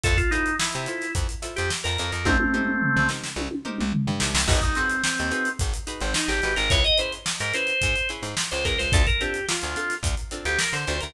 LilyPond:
<<
  \new Staff \with { instrumentName = "Drawbar Organ" } { \time 4/4 \key c \dorian \tempo 4 = 108 a'16 f'16 dis'8 e'4 r8. g'16 r16 bes'8 bes'16 | <a c'>4. r2 r8 | ees'16 ees'16 c'8 c'4 r8. c'16 ees'16 g'8 bes'16 | des''16 ees''16 c''16 r8 bes'16 c''4 r8. c''16 bes'16 c''16 |
a'16 bes'16 g'8 f'4 r8. g'16 bes'16 c''8 bes'16 | }
  \new Staff \with { instrumentName = "Pizzicato Strings" } { \time 4/4 \key c \dorian <e' f' a' c''>8 <e' f' a' c''>4 <e' f' a' c''>4 <e' f' a' c''>4 <e' f' a' c''>8 | <ees' g' bes' c''>8 <ees' g' bes' c''>4 <ees' g' bes' c''>4 <ees' g' bes' c''>4 <ees' g' bes' c''>8 | <ees' ges' aes' ces''>8 <ees' ges' aes' ces''>4 <ees' ges' aes' ces''>4 <ees' ges' aes' ces''>4 <ees' ges' aes' ces''>8 | <des' fes' aes' ces''>8 <des' fes' aes' ces''>4 <des' fes' aes' ces''>4 <des' fes' aes' ces''>4 <des' fes' aes' ces''>8 |
<c' d' f' a'>8 <c' d' f' a'>4 <c' d' f' a'>4 <c' d' f' a'>4 <c' d' f' a'>8 | }
  \new Staff \with { instrumentName = "Electric Bass (finger)" } { \clef bass \time 4/4 \key c \dorian f,4~ f,16 c8. f,8. f,8 f,16 f,16 f,16 | c,4~ c,16 c,8. c,8. c,8 g,16 c,16 c,16 | aes,,4~ aes,,16 ees,8. aes,,8. aes,,8 aes,,16 aes,,16 aes,,16 | des,4~ des,16 aes,8. aes,8. aes,8 des,16 des,16 des,16 |
d,4~ d,16 d,8. d,8. d,8 d16 d,16 d,16 | }
  \new DrumStaff \with { instrumentName = "Drums" } \drummode { \time 4/4 <hh bd>16 <hh bd>16 hh16 hh16 sn16 hh16 hh16 <hh sn>16 <hh bd>16 hh16 <hh sn>16 <hh sn>16 sn16 <hh sn>16 hh16 hh16 | <bd tommh>16 tommh16 toml16 toml16 tomfh16 tomfh16 sn16 sn16 tommh16 tommh16 toml16 toml16 tomfh16 tomfh16 sn16 sn16 | <cymc bd>16 <hh bd>16 hh16 hh16 sn16 hh16 hh16 hh16 <hh bd>16 hh16 hh16 hh16 sn16 <hh sn>16 <hh sn>16 <hh sn>16 | <hh bd>16 hh16 hh16 hh16 sn16 <hh sn>16 hh16 hh16 <hh bd>16 hh16 <hh sn>16 <hh sn>16 sn16 <hh sn>16 <hh bd>16 hh16 |
<hh bd>16 <hh bd>16 hh16 hh16 sn16 hh16 hh16 <hh sn>16 <hh bd>16 hh16 hh16 hh16 sn16 <hh sn>16 hh16 hh16 | }
>>